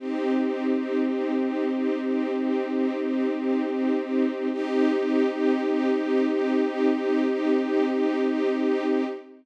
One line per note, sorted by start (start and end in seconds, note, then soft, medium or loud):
0.00 4.48 C4 loud
0.00 4.48 D#4 medium
0.00 4.48 G4 medium
4.53 9.04 C4 medium
4.53 9.04 D#4 loud
4.53 9.04 G4 loud